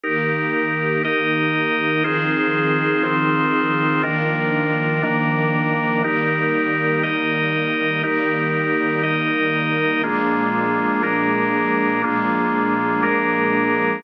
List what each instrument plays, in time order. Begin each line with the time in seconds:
0.03 string ensemble 1 D#3 A#3 G4, drawbar organ D#4 G4 A#4
1.04 drawbar organ D#4 A#4 D#5
2.04 string ensemble 1 D#3 F3 C4 G#4, drawbar organ D#4 F4 G#4 C5
3.03 drawbar organ C4 D#4 F4 C5
4.03 drawbar organ D#3 D4 F4 A#4, string ensemble 1 D#3 F3 A#3 D4
5.03 drawbar organ D#3 A#3 D4 A#4
6.04 string ensemble 1 D#3 G3 A#3, drawbar organ D#4 G4 A#4
7.03 drawbar organ D#4 A#4 D#5
8.03 string ensemble 1 D#3 G3 A#3, drawbar organ D#4 G4 A#4
9.03 drawbar organ D#4 A#4 D#5
10.03 string ensemble 1 A#2 F3 G#3 D4, drawbar organ A#3 D4 F4 G#4
11.03 drawbar organ A#3 D4 G#4 A#4
12.04 string ensemble 1 A#2 F3 G#3 D4, drawbar organ A#3 D4 F4 G#4
13.03 drawbar organ A#3 D4 G#4 A#4